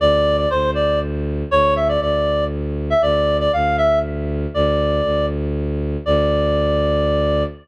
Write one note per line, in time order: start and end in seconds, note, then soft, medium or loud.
0.00 0.46 D2 loud
0.00 0.37 D5 loud
0.37 0.49 D5 loud
0.50 1.43 D2 medium
0.50 0.71 C5 loud
0.75 0.99 D5 loud
1.51 1.98 D2 medium
1.51 1.74 C#5 loud
1.76 1.88 E5 medium
1.89 2.01 D5 loud
2.01 2.93 D2 medium
2.01 2.45 D5 medium
2.90 3.02 E5 medium
3.02 3.48 D2 medium
3.02 3.37 D5 loud
3.40 3.52 D5 loud
3.53 4.46 D2 medium
3.53 3.76 F5 medium
3.78 3.99 E5 loud
4.54 5.01 D2 medium
4.54 5.26 D5 medium
5.04 5.97 D2 medium
6.06 7.44 D2 loud
6.06 7.43 D5 loud